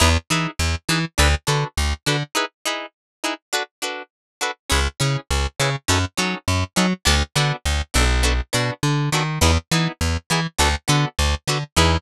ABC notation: X:1
M:4/4
L:1/8
Q:1/4=102
K:Emix
V:1 name="Acoustic Guitar (steel)"
[^DEGB] [DEGB]2 [DEGB] [=DFAB] [DFAB]2 [DFAB] | [^DEGB] [DEGB]2 [DEGB] [=DFAB] [DFAB]2 [DFAB] | [CEGB] [CEGB]2 [CEGB] [C^DFA] [CDFA]2 [CDFA] | [B,DFA] [B,DFA]2 [B,DFA] [B,DFA] [B,DFA]2 [B,DFA] |
[B,^DEG] [B,DEG]2 [B,DEG] [B,=DFA] [B,DFA]2 [B,DFA] | [^DEGB]2 z6 |]
V:2 name="Electric Bass (finger)" clef=bass
E,, E, E,, E, D,, D, D,, D, | z8 | C,, C, C,, C, F,, F, F,, F, | D,, D, D,, B,,,2 B,, D, ^D, |
E,, E, E,, E, D,, D, D,, D, | E,,2 z6 |]